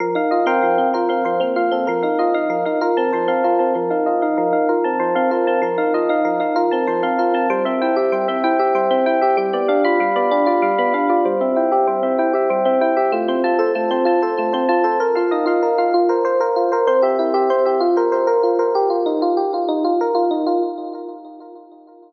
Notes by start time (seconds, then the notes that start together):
0.00 F3 A#4
0.15 D#4 F5
0.31 F4 D#5
0.46 C4 A#4 C5 F5 G5
0.63 F3
0.78 C4
0.94 F4 A#4
1.09 C4 F5
1.25 F3 C5
1.40 A#3 C4
1.56 F4 F5
1.71 C4 A4
1.87 F3 A#4
2.03 D#4 F5
2.19 F4 D#5
2.34 D#4 F5
2.50 F3 A#4
2.65 D#4 F5
2.81 F4 A#4
2.97 C4 A5
3.13 F3 C5
3.28 C4 F5
3.44 F4 A#4
3.59 C4 A5
3.75 F3 A#4
3.90 D#4 F5
4.06 F4 D#5
4.22 D#4 F5
4.37 F3 A#4
4.53 D#4 F5
4.69 F4 A#4
4.84 C4 A5
4.99 F3 C5
5.15 C4 F5
5.31 F4 A#4
5.47 C4 A5
5.62 F3 A#4
5.78 D#4 F5
5.94 F4 D#5
6.09 D#4 F5
6.25 F3 A#4
6.40 D#4 F5
6.56 F4 A#4
6.71 C4 A5
6.87 F3 C5
7.03 C4 F5
7.19 F4 A#4
7.34 C4 A5
7.50 G3 C5
7.65 C4 E5
7.81 E4 G5
7.96 G4 E5
8.12 G3 C5
8.28 C4 E5
8.44 E4 G5
8.59 G4 E5
8.75 G3 C5
8.91 C4 E5
9.06 E4 G5
9.21 G4 E5
9.37 G3 G4
9.53 B3 D5
9.68 D4 F5
9.85 F4 B5
10.00 G3 F5
10.16 B3 D5
10.31 D4 G4
10.46 F4 D5
10.62 G3 F5
10.78 B3 B5
10.94 D4 F5
11.10 F4 D5
11.25 G3 C5
11.41 C4 E5
11.56 E4 G5
11.71 G4 E5
11.87 G3 C5
12.03 C4 E5
12.18 E4 G5
12.33 G4 E5
12.50 G3 C5
12.65 C4 E5
12.81 E4 G5
12.97 G4 E5
13.12 A3 F4
13.28 C4 C5
13.44 F4 A5
13.59 A4 C5
13.75 A3 F4
13.91 C4 C5
14.05 F4 A5
14.22 A4 C5
14.37 A3 F4
14.53 C4 C5
14.69 F4 A5
14.84 A4 C5
15.00 A#4
15.15 F4 F5
15.31 D#4 D#5
15.46 F4 F5
15.63 A#4
15.78 F4 F5
15.94 F4
16.09 A#4 C5
16.25 A#4 C5
16.40 A#4 C5
16.56 F4
16.72 A#4 C5
16.87 C4 C5
17.02 G4 E5
17.19 E4 G4
17.34 G4 E5
17.50 C4 C5
17.65 G4 E5
17.80 F4
17.97 A#4 C5
18.12 A#4 C5
18.27 A#4 C5
18.43 F4
18.59 A#4 C5
18.75 G4
18.90 F4
19.06 D#4
19.22 F4
19.37 G4
19.54 F4
19.69 D#4
19.85 F4
20.01 A#4
20.15 F4
20.31 D#4
20.47 F4